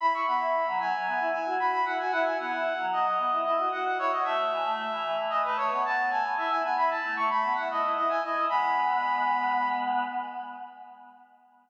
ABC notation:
X:1
M:4/4
L:1/16
Q:1/4=113
K:Bmix
V:1 name="Brass Section"
b c' b4 g4 g2 b b f g | f g f4 d4 d2 f f c d | e8 d B c2 a2 g2 | e g g b a2 c' b2 f d2 d g d2 |
b10 z6 |]
V:2 name="Choir Aahs"
E E B, E2 F, F, F, B, E E F F2 E F | E E B, E2 F, F, F, B, E E F F2 E F | A, A, E, A,2 E, E, E, E, A, A, B, B,2 A, B, | E E B, E2 A, A, A, B, E E E E2 E E |
[G,B,]12 z4 |]